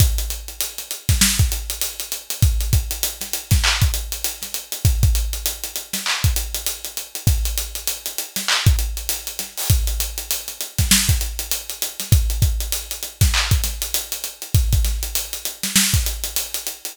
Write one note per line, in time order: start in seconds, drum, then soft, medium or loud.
0.00 kick loud
0.00 closed hi-hat loud
0.18 closed hi-hat medium
0.30 closed hi-hat medium
0.48 closed hi-hat medium
0.61 closed hi-hat loud
0.78 closed hi-hat medium
0.91 closed hi-hat medium
1.09 kick medium
1.09 snare medium
1.09 closed hi-hat medium
1.21 snare loud
1.39 kick medium
1.39 closed hi-hat medium
1.52 closed hi-hat medium
1.70 closed hi-hat medium
1.81 closed hi-hat loud
2.00 closed hi-hat medium
2.12 closed hi-hat medium
2.30 closed hi-hat medium
2.42 kick loud
2.42 closed hi-hat loud
2.61 closed hi-hat medium
2.73 kick medium
2.73 closed hi-hat medium
2.91 closed hi-hat medium
3.03 closed hi-hat loud
3.21 snare soft
3.21 closed hi-hat medium
3.33 closed hi-hat medium
3.51 kick medium
3.51 snare medium
3.51 closed hi-hat medium
3.64 clap loud
3.82 kick medium
3.82 closed hi-hat medium
3.94 closed hi-hat medium
4.12 closed hi-hat medium
4.24 closed hi-hat loud
4.42 snare soft
4.42 closed hi-hat medium
4.54 closed hi-hat medium
4.72 closed hi-hat medium
4.85 kick loud
4.85 closed hi-hat loud
5.03 kick loud
5.03 closed hi-hat medium
5.15 closed hi-hat medium
5.33 closed hi-hat medium
5.46 closed hi-hat loud
5.64 closed hi-hat medium
5.76 closed hi-hat medium
5.93 snare medium
5.93 closed hi-hat medium
6.06 clap loud
6.24 kick medium
6.24 closed hi-hat medium
6.36 closed hi-hat medium
6.55 closed hi-hat medium
6.67 closed hi-hat loud
6.85 closed hi-hat medium
6.97 closed hi-hat medium
7.15 closed hi-hat medium
7.27 kick loud
7.27 closed hi-hat loud
7.45 closed hi-hat medium
7.58 closed hi-hat medium
7.75 closed hi-hat medium
7.88 closed hi-hat loud
8.06 closed hi-hat medium
8.18 closed hi-hat medium
8.36 snare medium
8.36 closed hi-hat medium
8.48 clap loud
8.67 kick loud
8.67 closed hi-hat medium
8.79 closed hi-hat medium
8.97 closed hi-hat medium
9.09 closed hi-hat loud
9.27 closed hi-hat medium
9.39 snare soft
9.39 closed hi-hat medium
9.58 open hi-hat medium
9.70 kick loud
9.70 closed hi-hat loud
9.87 closed hi-hat medium
10.00 closed hi-hat loud
10.18 closed hi-hat medium
10.31 closed hi-hat loud
10.48 closed hi-hat medium
10.61 closed hi-hat medium
10.78 kick medium
10.78 snare medium
10.78 closed hi-hat medium
10.91 snare loud
11.09 kick medium
11.09 closed hi-hat medium
11.21 closed hi-hat medium
11.39 closed hi-hat medium
11.51 closed hi-hat loud
11.70 closed hi-hat medium
11.82 closed hi-hat loud
12.00 snare soft
12.00 closed hi-hat medium
12.12 kick loud
12.12 closed hi-hat loud
12.30 closed hi-hat medium
12.42 kick medium
12.42 closed hi-hat medium
12.60 closed hi-hat medium
12.72 closed hi-hat loud
12.91 closed hi-hat medium
13.03 closed hi-hat medium
13.21 kick medium
13.21 snare medium
13.21 closed hi-hat medium
13.34 clap loud
13.51 kick medium
13.51 closed hi-hat medium
13.64 snare soft
13.64 closed hi-hat medium
13.82 closed hi-hat medium
13.94 closed hi-hat loud
14.12 closed hi-hat medium
14.24 closed hi-hat medium
14.42 closed hi-hat medium
14.55 kick loud
14.55 closed hi-hat loud
14.73 kick medium
14.73 closed hi-hat medium
14.85 snare soft
14.85 closed hi-hat medium
15.03 closed hi-hat medium
15.15 closed hi-hat loud
15.33 closed hi-hat medium
15.45 closed hi-hat medium
15.63 snare medium
15.63 closed hi-hat medium
15.76 snare loud
15.94 kick medium
15.94 closed hi-hat medium
16.06 closed hi-hat medium
16.24 closed hi-hat medium
16.36 closed hi-hat loud
16.54 closed hi-hat medium
16.67 closed hi-hat medium
16.85 closed hi-hat medium